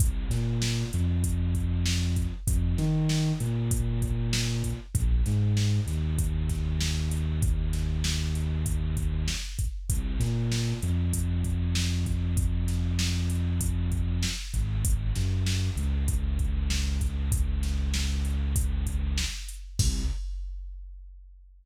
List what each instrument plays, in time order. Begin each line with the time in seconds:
0.00 synth bass 2 C2, kick, closed hi-hat
0.30 synth bass 2 A#2, snare, closed hi-hat
0.62 snare
0.93 synth bass 2 F2, closed hi-hat
1.24 kick, closed hi-hat
1.55 kick, closed hi-hat
1.86 snare
2.16 kick, closed hi-hat
2.47 synth bass 2 F2, kick, closed hi-hat
2.78 synth bass 2 D#3, snare, closed hi-hat
3.09 snare
3.40 synth bass 2 A#2, closed hi-hat
3.71 kick, closed hi-hat
4.02 kick, closed hi-hat
4.33 snare
4.64 kick, closed hi-hat
4.95 synth bass 2 A#1, kick, closed hi-hat
5.26 synth bass 2 G#2, snare, closed hi-hat
5.57 snare
5.86 synth bass 2 D#2, snare, closed hi-hat
6.19 kick, closed hi-hat
6.49 kick, snare, closed hi-hat
6.81 snare
7.11 closed hi-hat
7.42 kick, closed hi-hat
7.73 snare, closed hi-hat
8.04 snare
8.35 closed hi-hat
8.66 kick, closed hi-hat
8.97 kick, closed hi-hat
9.28 snare
9.59 kick, closed hi-hat
9.90 synth bass 2 C2, kick, closed hi-hat
10.20 synth bass 2 A#2, snare, closed hi-hat
10.52 snare
10.82 synth bass 2 F2, closed hi-hat
11.13 kick, closed hi-hat
11.44 kick, closed hi-hat
11.75 snare
12.06 kick, closed hi-hat
12.37 kick, closed hi-hat
12.68 snare, closed hi-hat
12.99 snare
13.30 closed hi-hat
13.61 kick, closed hi-hat
13.92 kick, closed hi-hat
14.23 snare
14.54 synth bass 2 G#1, kick, closed hi-hat
14.85 kick, closed hi-hat
15.15 synth bass 2 F#2, snare, closed hi-hat
15.46 snare
15.77 synth bass 2 C#2, closed hi-hat
16.08 kick, closed hi-hat
16.39 kick, closed hi-hat
16.70 snare
17.01 kick, closed hi-hat
17.32 kick, closed hi-hat
17.63 snare, closed hi-hat
17.94 snare
18.25 closed hi-hat
18.56 kick, closed hi-hat
18.87 kick, closed hi-hat
19.18 snare
19.48 closed hi-hat
19.79 synth bass 2 C2, kick, crash